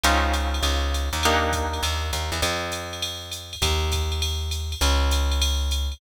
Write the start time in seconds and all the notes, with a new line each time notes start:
0.03 C#2 C4 C#4 D#4 F4, ride
0.34 hi-hat pedal, ride
0.54 ride
0.63 C#2, ride
0.94 hi-hat pedal, ride
1.13 D#2, ride
1.23 A#3 D4 D#4 G4, ride
1.53 kick, hi-hat pedal, ride
1.73 ride
1.83 D#2, ride
2.13 D#2, hi-hat pedal, ride
2.32 E2, ride
2.42 F2, ride
2.72 hi-hat pedal, ride
2.93 ride
3.02 ride
3.31 hi-hat pedal, ride
3.53 ride
3.62 D#2, kick, ride
3.92 kick, hi-hat pedal, ride
4.12 ride
4.22 ride
4.51 hi-hat pedal, ride
4.72 ride
4.81 C#2, ride
5.11 hi-hat pedal, ride
5.31 ride
5.42 ride
5.71 hi-hat pedal, ride
5.92 ride